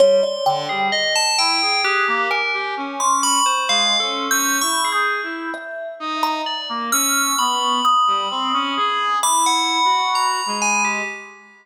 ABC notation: X:1
M:2/4
L:1/16
Q:1/4=65
K:none
V:1 name="Kalimba"
_d =d g2 z4 | _g'2 _a3 c' _d'2 | (3c'4 g'4 g'4 | e3 _b z2 f'2 |
_d'2 _e'6 | b8 |]
V:2 name="Brass Section"
G, z D, G, z2 E _A | _A _B, z G _D3 z | (3_A,2 _D2 D2 (3E2 _A2 E2 | z2 _E2 z _B, _D2 |
B,2 z G, C _D _A2 | (3E4 _G4 _A,4 |]
V:3 name="Tubular Bells"
c'3 _A _e =a g2 | G2 _B z2 d' =b c | (3f2 A2 e'2 _d' _A z2 | z4 d z e'2 |
b8 | d' _g3 _b2 _a =G |]